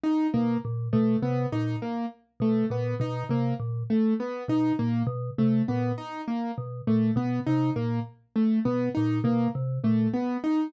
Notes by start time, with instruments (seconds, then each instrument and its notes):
0.03 acoustic grand piano D#4
0.34 vibraphone B2, acoustic grand piano A#3
0.65 vibraphone A#2
0.93 vibraphone B2, acoustic grand piano A3
1.22 vibraphone C3, acoustic grand piano B3
1.52 vibraphone A#2, acoustic grand piano D#4
1.82 acoustic grand piano A#3
2.40 vibraphone B2, acoustic grand piano A3
2.70 vibraphone A#2, acoustic grand piano B3
3.00 vibraphone B2, acoustic grand piano D#4
3.29 vibraphone C3, acoustic grand piano A#3
3.60 vibraphone A#2
3.90 acoustic grand piano A3
4.20 acoustic grand piano B3
4.48 vibraphone B2, acoustic grand piano D#4
4.79 vibraphone A#2, acoustic grand piano A#3
5.07 vibraphone B2
5.38 vibraphone C3, acoustic grand piano A3
5.68 vibraphone A#2, acoustic grand piano B3
5.98 acoustic grand piano D#4
6.28 acoustic grand piano A#3
6.58 vibraphone B2
6.87 vibraphone A#2, acoustic grand piano A3
7.16 vibraphone B2, acoustic grand piano B3
7.46 vibraphone C3, acoustic grand piano D#4
7.76 vibraphone A#2, acoustic grand piano A#3
8.36 acoustic grand piano A3
8.65 vibraphone B2, acoustic grand piano B3
8.95 vibraphone A#2, acoustic grand piano D#4
9.24 vibraphone B2, acoustic grand piano A#3
9.55 vibraphone C3
9.84 vibraphone A#2, acoustic grand piano A3
10.13 acoustic grand piano B3
10.44 acoustic grand piano D#4